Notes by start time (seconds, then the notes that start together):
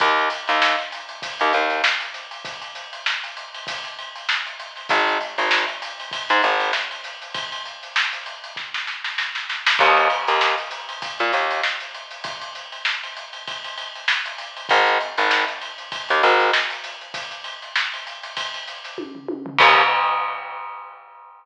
0.00 D#2, kick, closed hi-hat
0.17 closed hi-hat
0.30 closed hi-hat
0.48 D#2, closed hi-hat
0.62 snare
0.79 snare, closed hi-hat
0.91 snare, closed hi-hat
1.09 closed hi-hat
1.22 kick, closed hi-hat
1.39 D#2, closed hi-hat
1.53 D#2, closed hi-hat
1.70 snare, closed hi-hat
1.84 snare
2.00 closed hi-hat
2.14 snare, closed hi-hat
2.31 closed hi-hat
2.45 kick, closed hi-hat
2.61 closed hi-hat
2.75 closed hi-hat
2.93 closed hi-hat
3.06 snare
3.24 closed hi-hat
3.37 closed hi-hat
3.54 closed hi-hat
3.67 kick, closed hi-hat
3.84 snare, closed hi-hat
3.99 closed hi-hat
4.15 closed hi-hat
4.29 snare
4.46 closed hi-hat
4.60 closed hi-hat
4.76 snare, closed hi-hat
4.89 G#1, kick, closed hi-hat
5.08 closed hi-hat
5.21 closed hi-hat
5.38 G#1, closed hi-hat
5.51 snare
5.68 closed hi-hat
5.82 closed hi-hat
6.00 closed hi-hat
6.11 kick, closed hi-hat
6.29 G#2, closed hi-hat
6.43 G#1, closed hi-hat
6.60 closed hi-hat
6.73 snare
6.91 closed hi-hat
7.04 snare, closed hi-hat
7.22 closed hi-hat
7.34 kick, closed hi-hat
7.52 closed hi-hat
7.65 closed hi-hat
7.83 closed hi-hat
7.96 snare
8.13 closed hi-hat
8.26 closed hi-hat
8.44 closed hi-hat
8.56 kick, snare
8.74 snare
8.87 snare
9.04 snare
9.18 snare
9.35 snare
9.49 snare
9.66 snare
9.79 D#2, kick, crash
9.97 closed hi-hat
10.10 closed hi-hat
10.27 D#2, closed hi-hat
10.41 snare
10.58 closed hi-hat
10.71 closed hi-hat
10.89 closed hi-hat
11.02 kick, closed hi-hat
11.19 A#2, closed hi-hat
11.32 D#2, snare, closed hi-hat
11.51 closed hi-hat
11.63 snare
11.80 closed hi-hat
11.94 closed hi-hat
12.11 closed hi-hat
12.24 kick, closed hi-hat
12.41 closed hi-hat
12.55 closed hi-hat
12.72 closed hi-hat
12.85 snare
13.03 closed hi-hat
13.17 closed hi-hat
13.33 closed hi-hat
13.47 kick, closed hi-hat
13.64 closed hi-hat
13.78 closed hi-hat
13.95 closed hi-hat
14.08 snare
14.26 closed hi-hat
14.38 closed hi-hat
14.57 closed hi-hat
14.69 G#1, kick, closed hi-hat
14.86 closed hi-hat
15.01 closed hi-hat
15.17 G#1, snare, closed hi-hat
15.31 snare
15.47 snare, closed hi-hat
15.61 closed hi-hat
15.78 closed hi-hat
15.92 kick, closed hi-hat
16.08 D#2, snare, closed hi-hat
16.23 G#1, closed hi-hat
16.40 closed hi-hat
16.53 snare
16.70 closed hi-hat
16.84 closed hi-hat
17.01 closed hi-hat
17.14 kick, closed hi-hat
17.31 closed hi-hat
17.44 closed hi-hat
17.62 snare, closed hi-hat
17.76 snare
17.93 closed hi-hat
18.07 closed hi-hat
18.23 snare, closed hi-hat
18.37 kick, closed hi-hat
18.54 closed hi-hat
18.67 closed hi-hat
18.84 snare, closed hi-hat
18.98 kick, high tom
19.15 floor tom
19.28 high tom
19.46 floor tom
19.59 D#2, kick, crash